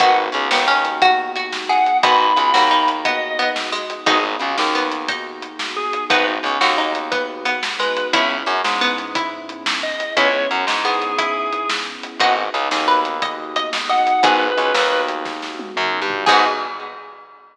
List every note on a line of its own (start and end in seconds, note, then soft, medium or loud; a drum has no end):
0.00 0.29 G#1 medium
0.00 2.01 B3 medium
0.00 0.24 B3 medium
0.00 2.01 D#4 medium
0.00 0.24 D#4 medium
0.00 2.01 F#4 medium
0.00 0.16 F#4 medium
0.00 0.24 F#4 medium
0.00 2.01 G#4 medium
0.00 0.24 G#4 loud
0.00 0.16 F#5 loud
0.00 kick medium
0.00 closed hi-hat medium
0.32 0.49 C#2 medium
0.32 0.47 C#3 medium
0.32 closed hi-hat medium
0.51 1.81 D#2 medium
0.51 1.82 D#3 medium
0.51 0.66 B3 medium
0.51 snare loud
0.68 0.97 C#4 medium
0.85 closed hi-hat medium
1.02 1.31 F#4 medium
1.02 kick medium
1.02 closed hi-hat medium
1.36 1.65 F#4 medium
1.36 closed hi-hat medium
1.53 snare medium
1.69 1.98 G#4 medium
1.69 1.97 F#5 medium
1.86 closed hi-hat medium
2.03 2.32 G#1 medium
2.03 2.27 B3 medium
2.03 4.05 B3 medium
2.03 2.19 B3 medium
2.03 2.27 D#4 medium
2.03 4.05 D#4 medium
2.03 2.27 F#4 loud
2.03 4.05 F#4 medium
2.03 2.27 G#4 medium
2.03 4.05 G#4 medium
2.03 2.88 B5 medium
2.03 kick medium
2.03 closed hi-hat loud
2.36 2.52 C#2 medium
2.36 2.51 C#3 medium
2.36 closed hi-hat medium
2.54 3.85 D#2 medium
2.54 3.84 D#3 medium
2.54 2.69 F#4 medium
2.54 snare medium
2.71 2.99 D#4 medium
2.88 closed hi-hat medium
3.05 3.34 B3 medium
3.05 3.50 D#5 medium
3.05 kick medium
3.05 closed hi-hat medium
3.39 3.71 B3 medium
3.39 closed hi-hat medium
3.56 snare medium
3.72 4.05 G#3 medium
3.90 closed hi-hat medium
4.06 4.36 G#1 medium
4.06 4.18 B3 medium
4.06 6.09 B3 medium
4.06 4.18 D#4 medium
4.06 4.35 D#4 medium
4.06 6.09 D#4 medium
4.06 4.18 F#4 loud
4.06 6.09 F#4 medium
4.06 4.18 G#4 medium
4.06 4.23 G#4 loud
4.06 6.09 G#4 medium
4.06 kick loud
4.06 closed hi-hat medium
4.39 4.56 C#2 medium
4.39 4.54 C#3 medium
4.39 closed hi-hat medium
4.58 5.88 D#2 medium
4.58 5.87 D#3 medium
4.58 snare medium
4.75 5.04 B3 medium
4.92 closed hi-hat medium
5.08 5.95 D#4 medium
5.08 kick medium
5.08 closed hi-hat medium
5.42 closed hi-hat medium
5.59 snare medium
5.76 6.04 G#4 medium
5.93 closed hi-hat medium
6.10 6.39 G#1 medium
6.10 6.24 B3 medium
6.10 8.12 B3 medium
6.10 6.35 B3 medium
6.10 8.12 D#4 medium
6.10 6.35 D#4 medium
6.10 8.12 F#4 medium
6.10 6.35 F#4 medium
6.10 8.12 G#4 medium
6.10 6.35 G#4 loud
6.10 6.25 B4 medium
6.10 kick loud
6.10 closed hi-hat medium
6.43 6.57 C#2 medium
6.43 6.60 C#3 medium
6.43 closed hi-hat medium
6.61 7.91 D#2 medium
6.61 7.92 D#3 medium
6.61 6.75 F#4 medium
6.61 snare medium
6.78 7.09 D#4 medium
6.95 closed hi-hat medium
7.12 7.45 B3 medium
7.12 kick medium
7.12 closed hi-hat medium
7.45 7.73 B3 medium
7.45 closed hi-hat medium
7.63 snare loud
7.79 8.07 G#3 medium
7.79 8.07 B4 medium
7.97 closed hi-hat medium
8.13 8.43 C#2 medium
8.13 8.37 B3 medium
8.13 10.15 B3 medium
8.13 8.37 C#4 medium
8.13 10.15 C#4 medium
8.13 8.37 E4 loud
8.13 8.43 E4 medium
8.13 10.15 E4 medium
8.13 8.37 G#4 medium
8.13 10.15 G#4 medium
8.13 8.28 E5 medium
8.13 kick medium
8.13 closed hi-hat medium
8.46 8.61 F#2 medium
8.46 8.61 F#3 medium
8.46 closed hi-hat medium
8.64 9.94 G#2 medium
8.64 9.95 G#3 medium
8.64 snare medium
8.81 9.14 B3 medium
8.98 closed hi-hat medium
9.15 9.97 E4 medium
9.15 kick medium
9.15 closed hi-hat medium
9.49 closed hi-hat medium
9.66 snare loud
9.83 10.13 D#5 medium
10.00 closed hi-hat medium
10.17 10.46 C#2 medium
10.17 10.29 B3 medium
10.17 12.19 B3 medium
10.17 10.29 C#4 medium
10.17 12.19 C#4 medium
10.17 10.29 E4 medium
10.17 12.19 E4 medium
10.17 10.45 E4 medium
10.17 10.29 G#4 medium
10.17 12.19 G#4 medium
10.17 10.47 C#5 loud
10.17 kick medium
10.17 closed hi-hat medium
10.51 10.65 F#2 medium
10.51 10.66 F#3 medium
10.51 closed hi-hat medium
10.67 11.97 G#2 medium
10.67 11.98 G#3 medium
10.67 snare medium
10.85 11.13 B3 medium
10.85 11.69 G#4 medium
11.02 closed hi-hat medium
11.18 12.11 E4 medium
11.18 kick medium
11.18 closed hi-hat medium
11.53 closed hi-hat medium
11.69 snare loud
12.03 closed hi-hat medium
12.20 12.48 G#1 medium
12.20 12.44 B3 medium
12.20 14.22 B3 medium
12.20 12.44 D#4 medium
12.20 14.22 D#4 medium
12.20 12.44 F#4 medium
12.20 14.22 F#4 medium
12.20 12.44 G#4 medium
12.20 14.22 G#4 medium
12.20 12.34 D#5 medium
12.20 12.34 F#5 loud
12.20 kick medium
12.20 closed hi-hat medium
12.54 12.68 C#2 medium
12.54 12.69 C#3 medium
12.54 closed hi-hat medium
12.71 14.01 D#2 medium
12.71 14.01 D#3 medium
12.71 12.87 G#4 medium
12.71 snare medium
12.88 13.21 B4 medium
13.05 closed hi-hat medium
13.22 13.54 D#5 medium
13.22 kick medium
13.22 closed hi-hat medium
13.56 13.88 D#5 medium
13.56 closed hi-hat medium
13.73 snare loud
13.89 14.20 D#5 medium
13.89 14.23 F#5 medium
14.07 closed hi-hat medium
14.23 14.52 G#1 medium
14.23 14.47 B3 medium
14.23 16.25 B3 medium
14.23 14.47 D#4 medium
14.23 16.25 D#4 medium
14.23 14.47 F#4 medium
14.23 16.25 F#4 medium
14.23 14.47 G#4 medium
14.23 16.25 G#4 medium
14.23 14.87 G#4 medium
14.23 15.02 B4 loud
14.23 kick loud
14.23 closed hi-hat loud
14.57 14.72 C#2 medium
14.57 14.72 C#3 medium
14.57 closed hi-hat medium
14.74 15.71 D#2 medium
14.74 15.71 D#3 medium
14.74 snare loud
15.08 closed hi-hat medium
15.25 kick medium
15.25 snare medium
15.42 snare medium
15.59 high tom medium
15.76 16.00 F#2 medium
15.76 16.00 F#3 medium
15.76 mid tom medium
16.01 16.25 G2 medium
16.01 16.24 G3 medium
16.10 floor tom loud
16.26 16.45 G#2 loud
16.26 16.45 B3 loud
16.26 16.46 B3 loud
16.26 16.45 D#4 medium
16.26 16.46 D#4 loud
16.26 16.45 F#4 medium
16.26 16.46 F#4 medium
16.26 16.44 G#4 loud
16.26 16.45 G#4 medium
16.26 16.45 G#4 loud
16.26 16.46 G#4 loud
16.26 kick loud
16.26 crash loud